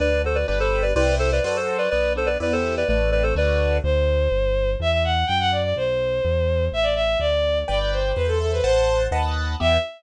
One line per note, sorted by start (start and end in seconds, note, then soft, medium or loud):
0.00 0.45 D2 medium
0.00 0.22 D4 medium
0.00 0.22 B4 medium
0.00 0.22 D5 medium
0.24 0.46 F#4 medium
0.24 0.37 A4 medium
0.24 0.37 C5 medium
0.35 0.47 B4 medium
0.35 0.47 D5 medium
0.47 0.93 G1 loud
0.47 0.91 D4 medium
0.47 0.91 G4 medium
0.47 0.59 B4 medium
0.47 0.91 B4 loud
0.47 0.59 D5 medium
0.60 0.83 A4 medium
0.60 0.83 C5 medium
0.82 0.94 B4 medium
0.82 0.94 D5 medium
0.96 1.40 C2 loud
0.96 1.39 E4 loud
0.96 1.39 G4 loud
0.96 1.15 B4 medium
0.96 1.39 C5 loud
0.96 1.15 D5 medium
1.19 1.30 A4 medium
1.19 1.30 C5 medium
1.32 1.44 B4 medium
1.32 1.44 D5 medium
1.44 1.88 F#2 loud
1.44 1.87 F#4 medium
1.44 1.87 A4 loud
1.44 1.56 B4 medium
1.44 1.87 C5 loud
1.44 1.56 D5 medium
1.56 1.77 A4 medium
1.56 1.77 C5 medium
1.78 1.90 B4 medium
1.78 1.90 D5 medium
1.90 2.37 B1 medium
1.90 2.38 B3 loud
1.90 2.13 B4 medium
1.90 2.13 D5 medium
2.16 2.39 D4 medium
2.16 2.28 A4 medium
2.16 2.28 C5 medium
2.26 2.38 B4 medium
2.26 2.38 D5 medium
2.40 2.84 E2 loud
2.40 2.83 B3 medium
2.40 2.83 E4 medium
2.40 2.83 G4 medium
2.40 2.53 B4 medium
2.40 2.53 D5 medium
2.52 2.75 A4 medium
2.52 2.75 C5 medium
2.77 2.88 B4 medium
2.77 2.88 D5 medium
2.88 3.33 A1 loud
2.88 3.34 A3 loud
2.88 3.11 B4 medium
2.88 3.11 D5 medium
3.12 3.34 C4 medium
3.12 3.23 B4 medium
3.12 3.23 D5 medium
3.23 3.34 A4 medium
3.23 3.34 C5 medium
3.35 3.79 D2 loud
3.35 3.79 A3 medium
3.35 3.79 D4 medium
3.35 3.79 F#4 loud
3.35 3.77 B4 medium
3.35 3.77 D5 medium
3.83 4.28 D2 loud
3.83 4.71 C5 medium
4.32 4.76 G1 loud
4.80 5.24 E2 loud
4.80 4.91 E5 medium
4.91 5.03 E5 medium
5.04 5.25 F#5 medium
5.27 5.73 F#2 loud
5.27 5.38 G5 medium
5.40 5.51 F#5 medium
5.52 5.63 D5 medium
5.63 5.75 D5 medium
5.76 6.20 B1 loud
5.76 6.65 C5 medium
6.25 6.69 E2 loud
6.72 7.16 A1 medium
6.72 6.85 E5 medium
6.83 6.94 D5 medium
6.95 7.18 E5 medium
7.20 7.64 D2 loud
7.20 7.58 D5 medium
7.68 8.13 G1 loud
7.68 8.11 B4 medium
7.68 8.11 D5 medium
7.68 7.79 D5 medium
7.68 8.11 G5 loud
7.79 7.91 D5 medium
7.92 8.15 C5 medium
8.15 8.61 E2 loud
8.15 8.27 B4 medium
8.15 8.62 C5 loud
8.27 8.38 A4 medium
8.40 8.51 A4 medium
8.40 8.63 E5 medium
8.53 8.64 B4 medium
8.64 9.08 A1 medium
8.64 9.02 C5 medium
8.64 9.07 C5 medium
8.64 9.07 F#5 medium
8.64 9.07 A5 medium
9.11 9.56 D#2 loud
9.11 9.55 B4 loud
9.11 9.55 D#5 medium
9.11 9.55 F#5 loud
9.11 9.55 A5 loud
9.60 9.78 E2 loud
9.60 9.77 B3 loud
9.60 9.77 E4 medium
9.60 9.77 G4 loud
9.60 9.77 E5 loud